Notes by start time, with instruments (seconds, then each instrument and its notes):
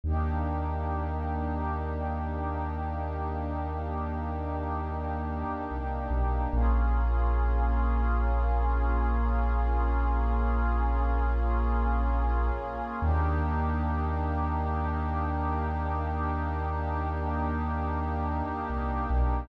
0.04 synth bass 2 D#2, pad 2 (warm) A#3 D4 D#4 G4
5.71 synth bass 2 C2
6.10 synth bass 2 B1
6.53 synth bass 2 A#1, pad 2 (warm) A#3 C#4 F4 G#4
13.01 synth bass 2 D#2, pad 2 (warm) A#3 D4 D#4 G4
18.70 synth bass 2 C2
19.10 synth bass 2 B1